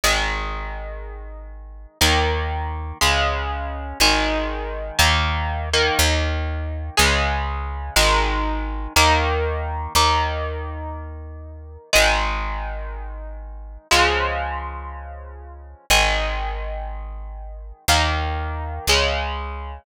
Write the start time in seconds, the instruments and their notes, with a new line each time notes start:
0.04 electric bass (finger) G#1, overdriven guitar D#3 G#3
2.01 electric bass (finger) D#2, overdriven guitar D#3 A#3
3.01 electric bass (finger) C#2, overdriven guitar C#3 G#3
4.00 electric bass (finger) G#1, overdriven guitar D#3 G#3
4.99 electric bass (finger) D#2, overdriven guitar D#3 A#3
5.73 overdriven guitar D#3 A#3
5.99 electric bass (finger) D#2
6.97 electric bass (finger) C#2, overdriven guitar C#3 G#3
7.96 electric bass (finger) G#1, overdriven guitar D#3 G#3
8.96 electric bass (finger) D#2, overdriven guitar D#3 A#3
9.95 electric bass (finger) D#2, overdriven guitar D#3 A#3
11.93 electric bass (finger) G#1, overdriven guitar D#3 G#3
13.91 electric bass (finger) C#2, overdriven guitar C#3 F3 G#3
15.90 electric bass (finger) G#1, overdriven guitar D#3 G#3
17.88 electric bass (finger) D#2, overdriven guitar D#3 A#3
18.87 electric bass (finger) C#2, overdriven guitar C#3 G#3